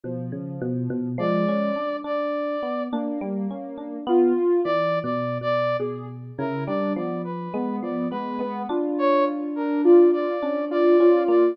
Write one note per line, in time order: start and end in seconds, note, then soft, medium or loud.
0.04 0.30 B2 medium
0.04 1.08 F3 medium
0.32 0.58 C#3 medium
0.62 0.88 B2 loud
0.90 1.16 B2 loud
1.18 1.44 F3 loud
1.18 1.71 G#3 loud
1.18 1.97 D5 medium
1.49 1.75 C#4 medium
1.76 2.02 D4 medium
2.04 2.56 D4 medium
2.04 2.83 D5 medium
2.63 2.89 B3 medium
2.92 3.96 A#3 medium
2.92 3.19 D4 medium
3.21 3.47 G3 loud
3.51 3.77 C#4 medium
3.78 4.04 D4 medium
4.07 4.33 B3 loud
4.07 4.60 F4 loud
4.64 5.00 E3 medium
4.64 4.99 D5 loud
5.03 5.38 B2 medium
5.03 5.38 D5 medium
5.41 5.76 B2 medium
5.41 5.77 D5 loud
5.80 6.31 B2 medium
5.80 6.06 G#4 medium
6.38 6.65 C#3 loud
6.38 6.65 E4 medium
6.38 6.64 A#4 medium
6.67 6.94 G3 medium
6.67 6.93 D4 medium
6.67 6.93 D5 medium
6.96 7.48 F3 medium
6.96 7.22 B3 medium
6.96 7.22 D5 soft
7.24 7.76 B4 medium
7.54 7.80 G#3 loud
7.54 8.06 B3 medium
7.82 8.09 F3 medium
7.82 8.08 D5 medium
8.11 8.38 G#3 medium
8.11 8.38 B3 medium
8.11 8.62 B4 medium
8.39 8.65 G#3 medium
8.39 8.66 B3 loud
8.69 10.25 D4 loud
8.69 9.48 F4 medium
8.99 9.25 C#5 loud
9.56 9.82 D4 medium
9.56 9.81 A#4 medium
9.84 10.36 F4 medium
9.84 10.11 D5 medium
10.13 10.65 D5 medium
10.43 10.69 C#4 medium
10.43 10.94 D4 medium
10.71 10.97 F4 medium
10.71 11.23 D5 medium
11.00 11.26 C#4 medium
11.00 11.52 F4 medium
11.28 11.54 A#3 medium
11.28 11.55 D5 medium